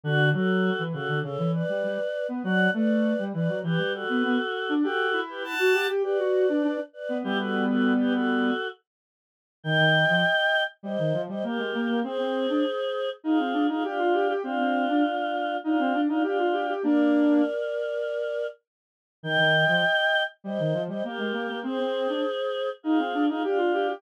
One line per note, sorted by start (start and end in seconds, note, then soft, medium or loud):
0.04 0.32 D3 loud
0.04 0.29 D4 loud
0.04 0.29 F#4 loud
0.33 0.70 F#3 loud
0.33 0.83 F#4 medium
0.33 0.83 A4 loud
0.79 0.93 E3 loud
0.92 1.08 C#3 loud
0.92 1.20 F#4 medium
0.92 1.20 A4 loud
1.08 1.22 D3 loud
1.22 1.37 C#3 loud
1.22 1.52 A4 medium
1.22 1.52 C#5 loud
1.38 1.62 E3 loud
1.53 2.27 B4 loud
1.53 2.27 D5 loud
1.69 1.83 G3 medium
1.84 1.98 G3 loud
2.29 2.43 B3 loud
2.44 2.68 F#3 loud
2.44 2.70 D5 loud
2.44 2.70 F#5 loud
2.73 3.14 A3 loud
2.73 3.24 B4 loud
2.73 3.24 D5 loud
3.18 3.33 G3 medium
3.33 3.48 E3 loud
3.33 3.59 B4 medium
3.33 3.59 D5 loud
3.48 3.62 F#3 medium
3.64 3.78 E3 loud
3.64 3.93 G4 loud
3.64 3.93 B4 loud
3.79 4.04 G3 medium
3.93 4.74 F#4 medium
3.93 4.74 A4 loud
4.09 4.23 B3 loud
4.23 4.38 B3 loud
4.69 4.83 D4 loud
4.83 5.20 F#4 loud
4.83 5.08 G4 loud
4.83 5.20 A4 loud
5.13 5.53 E4 loud
5.29 5.43 G4 medium
5.29 5.43 B4 loud
5.44 5.87 F#5 medium
5.44 5.87 A5 loud
5.59 5.73 F#4 medium
5.74 5.88 G4 loud
5.88 6.03 G4 loud
6.03 6.18 G4 loud
6.03 6.81 B4 loud
6.03 6.81 D5 loud
6.19 6.46 F#4 medium
6.49 6.63 D4 medium
6.63 6.77 D4 loud
6.93 7.17 B4 medium
6.93 7.17 D5 loud
7.09 7.23 B3 loud
7.24 8.51 G3 loud
7.24 8.51 B3 loud
7.24 7.38 E4 loud
7.24 7.38 G4 loud
7.38 7.65 F#4 medium
7.38 7.65 A4 loud
7.68 7.93 F#4 medium
7.68 7.93 A4 loud
7.99 8.13 G4 loud
7.99 8.13 B4 loud
8.13 8.68 F#4 medium
8.13 8.68 A4 loud
9.64 9.77 D#3 medium
9.64 10.63 D#5 loud
9.64 10.63 G5 loud
9.78 10.05 D#3 loud
10.09 10.23 F3 medium
10.83 10.97 G3 medium
10.83 11.21 C5 medium
10.83 11.21 D#5 loud
10.98 11.13 D#3 medium
11.13 11.28 F3 medium
11.29 11.43 G3 medium
11.29 11.44 C5 medium
11.29 11.44 D#5 loud
11.44 11.58 A#3 medium
11.44 12.00 G4 medium
11.44 12.00 A#4 medium
11.58 11.72 G#3 medium
11.74 11.88 A#3 loud
11.88 12.02 A#3 medium
12.04 12.18 C4 loud
12.04 13.10 G#4 loud
12.04 13.10 C5 loud
12.18 12.47 C4 loud
12.49 12.63 D4 medium
13.24 13.38 D#4 medium
13.24 13.67 F4 medium
13.24 13.67 G#4 loud
13.39 13.53 C4 medium
13.53 13.67 D4 medium
13.68 13.83 D#4 medium
13.68 13.83 F4 loud
13.68 13.83 G#4 loud
13.84 14.33 D4 medium
13.84 14.33 F4 loud
13.84 13.98 G4 loud
13.99 14.13 F4 loud
14.13 14.28 G4 medium
14.29 14.43 G4 loud
14.43 14.58 C4 loud
14.43 15.57 D4 loud
14.43 15.57 F4 loud
14.58 14.86 C4 loud
14.89 15.03 D4 medium
15.64 16.01 D4 medium
15.64 15.78 D#4 medium
15.64 16.01 F4 loud
15.79 15.93 C4 loud
15.93 16.08 D4 medium
16.09 16.23 D4 loud
16.09 16.23 D#4 medium
16.09 16.23 F4 loud
16.23 16.73 D4 medium
16.23 16.73 F4 loud
16.23 16.38 G4 medium
16.38 16.52 F4 medium
16.53 16.67 G4 medium
16.68 16.83 G4 medium
16.83 17.42 A#3 medium
16.83 17.42 D4 loud
16.83 18.47 A#4 loud
16.83 18.47 D5 loud
19.23 19.37 D#3 medium
19.23 20.23 D#5 loud
19.23 20.23 G5 loud
19.38 19.65 D#3 loud
19.68 19.82 F3 medium
20.44 20.58 G3 medium
20.44 20.82 C5 medium
20.44 20.82 D#5 loud
20.59 20.73 D#3 medium
20.73 20.88 F3 medium
20.88 21.03 G3 medium
20.88 21.03 C5 medium
20.88 21.03 D#5 loud
21.04 21.18 A#3 medium
21.04 21.60 G4 medium
21.04 21.60 A#4 medium
21.18 21.32 G#3 medium
21.33 21.47 A#3 loud
21.49 21.63 A#3 medium
21.63 21.77 C4 loud
21.63 22.70 G#4 loud
21.63 22.70 C5 loud
21.79 22.08 C4 loud
22.09 22.23 D4 medium
22.83 22.98 D#4 medium
22.83 23.26 F4 medium
22.83 23.26 G#4 loud
22.98 23.13 C4 medium
23.14 23.28 D4 medium
23.28 23.43 D#4 medium
23.28 23.43 F4 loud
23.28 23.43 G#4 loud
23.44 23.94 D4 medium
23.44 23.94 F4 loud
23.44 23.58 G4 loud
23.58 23.72 F4 loud
23.73 23.87 G4 medium
23.88 24.02 G4 loud